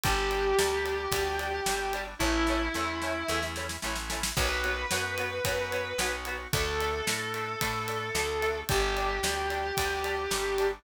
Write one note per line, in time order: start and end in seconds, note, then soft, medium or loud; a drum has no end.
0.03 0.53 G1 loud
0.03 0.15 G3 medium
0.03 0.53 G3 loud
0.03 0.53 D4 loud
0.03 0.15 D4 medium
0.03 2.01 G4 medium
0.03 kick loud
0.03 ride loud
0.31 0.42 G3 medium
0.31 0.42 D4 medium
0.31 ride medium
0.58 1.07 D2 medium
0.58 1.06 G3 medium
0.58 0.69 G3 medium
0.58 1.06 D4 loud
0.58 0.69 D4 medium
0.58 snare loud
0.85 0.96 G3 medium
0.85 0.96 D4 medium
0.85 ride medium
1.12 1.60 D2 medium
1.12 1.61 G3 medium
1.12 1.23 G3 medium
1.12 1.61 D4 loud
1.12 1.23 D4 medium
1.12 kick medium
1.12 ride loud
1.39 1.50 G3 medium
1.39 1.50 D4 medium
1.39 ride medium
1.66 2.15 G1 medium
1.66 2.15 G3 medium
1.66 1.77 G3 medium
1.66 2.15 D4 loud
1.66 1.77 D4 medium
1.66 snare loud
1.93 2.04 G3 medium
1.93 2.04 D4 medium
1.93 ride medium
2.19 2.69 A1 loud
2.19 2.69 A3 loud
2.19 2.31 A3 medium
2.19 2.69 C#4 loud
2.19 2.31 C#4 medium
2.19 3.42 E4 medium
2.19 2.69 E4 loud
2.19 kick medium
2.19 snare medium
2.23 2.31 E4 medium
2.47 2.59 A3 medium
2.47 2.59 C#4 medium
2.47 2.59 E4 medium
2.47 snare medium
2.74 3.24 E2 medium
2.74 2.85 A3 medium
2.74 3.23 A3 loud
2.74 3.23 C#4 loud
2.74 2.85 C#4 medium
2.74 3.23 E4 loud
2.74 2.85 E4 medium
2.74 snare medium
3.02 3.13 A3 medium
3.02 3.13 C#4 medium
3.02 3.13 E4 medium
3.02 snare medium
3.28 3.78 E2 loud
3.28 3.77 A3 loud
3.28 3.40 A3 medium
3.28 3.77 C#4 loud
3.28 3.40 C#4 medium
3.28 3.77 E4 loud
3.28 3.40 E4 medium
3.28 snare medium
3.43 snare medium
3.56 3.67 A3 medium
3.56 3.67 C#4 medium
3.56 3.67 E4 medium
3.56 snare medium
3.69 snare medium
3.82 4.32 A1 medium
3.82 4.31 A3 loud
3.82 3.94 A3 medium
3.82 4.31 C#4 loud
3.82 3.94 C#4 medium
3.82 4.31 E4 medium
3.82 3.94 E4 medium
3.82 snare medium
3.95 snare medium
4.09 4.20 A3 medium
4.09 4.20 C#4 medium
4.09 4.20 E4 medium
4.09 snare loud
4.23 snare loud
4.37 4.85 B1 loud
4.37 4.47 F#3 medium
4.37 4.85 B3 loud
4.37 4.47 B3 medium
4.37 4.85 F#4 loud
4.37 6.12 B4 medium
4.37 kick loud
4.37 crash loud
4.64 4.75 F#3 medium
4.64 4.75 B3 medium
4.64 ride medium
4.90 5.40 F#2 medium
4.90 5.01 F#3 medium
4.90 5.40 B3 loud
4.90 5.01 B3 medium
4.90 5.40 F#4 medium
4.90 snare loud
5.18 5.29 F#3 medium
5.18 5.29 B3 medium
5.18 ride medium
5.44 5.93 F#2 medium
5.44 5.56 F#3 medium
5.44 5.93 B3 loud
5.44 5.56 B3 medium
5.44 5.93 F#4 loud
5.44 kick medium
5.44 ride loud
5.72 5.83 F#3 medium
5.72 5.83 B3 medium
5.72 ride medium
5.98 6.47 B1 medium
5.98 6.10 F#3 medium
5.98 6.48 B3 medium
5.98 6.10 B3 medium
5.98 6.48 F#4 loud
5.98 snare loud
6.25 6.37 F#3 medium
6.25 6.37 B3 medium
6.25 ride medium
6.53 7.02 D2 loud
6.53 7.01 A3 loud
6.53 6.64 A3 medium
6.53 7.01 D4 loud
6.53 6.64 D4 medium
6.53 8.60 A4 medium
6.53 kick loud
6.53 ride loud
6.80 6.91 A3 medium
6.80 6.91 D4 medium
6.80 ride medium
7.07 7.56 A2 medium
7.07 7.55 A3 loud
7.07 7.18 A3 medium
7.07 7.55 D4 medium
7.07 7.18 D4 medium
7.07 snare loud
7.34 7.45 A3 medium
7.34 7.45 D4 medium
7.34 ride medium
7.61 8.11 A2 medium
7.61 7.72 A3 medium
7.61 8.09 A3 loud
7.61 8.09 D4 loud
7.61 7.72 D4 medium
7.61 kick medium
7.61 ride loud
7.88 7.99 A3 medium
7.88 7.99 D4 medium
7.88 ride medium
8.15 8.63 D2 medium
8.15 8.26 A3 medium
8.15 8.64 A3 medium
8.15 8.64 D4 loud
8.15 8.26 D4 medium
8.15 snare loud
8.42 8.53 A3 medium
8.42 8.53 D4 medium
8.42 ride medium
8.69 9.20 G1 loud
8.69 8.80 G3 medium
8.69 9.18 G3 loud
8.69 9.18 D4 loud
8.69 8.80 D4 medium
8.69 10.67 G4 medium
8.69 kick loud
8.69 ride loud
8.96 9.07 G3 medium
8.96 9.07 D4 medium
8.96 ride medium
9.23 9.72 D2 medium
9.23 9.72 G3 medium
9.23 9.34 G3 medium
9.23 9.72 D4 loud
9.23 9.34 D4 medium
9.23 snare loud
9.50 9.61 G3 medium
9.50 9.61 D4 medium
9.50 ride medium
9.77 10.28 D2 medium
9.77 10.26 G3 medium
9.77 9.88 G3 medium
9.77 10.26 D4 loud
9.77 9.88 D4 medium
9.77 kick medium
9.77 ride loud
10.04 10.15 G3 medium
10.04 10.15 D4 medium
10.04 ride medium
10.31 10.79 G1 medium
10.31 10.80 G3 medium
10.31 10.43 G3 medium
10.31 10.80 D4 loud
10.31 10.43 D4 medium
10.31 snare loud
10.58 10.70 G3 medium
10.58 10.70 D4 medium
10.58 ride medium